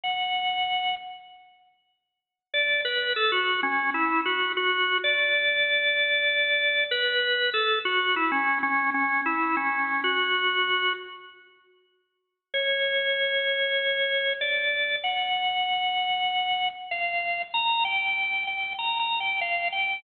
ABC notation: X:1
M:4/4
L:1/16
Q:1/4=96
K:F#m
V:1 name="Drawbar Organ"
f6 z10 | d2 B2 A F2 C2 E2 F2 F3 | d12 B4 | A2 F2 E C2 C2 C2 E2 C3 |
F6 z10 | [K:Gm] _d12 =d4 | ^f12 =f4 | b2 g4 g2 (3b2 b2 g2 f2 g2 |]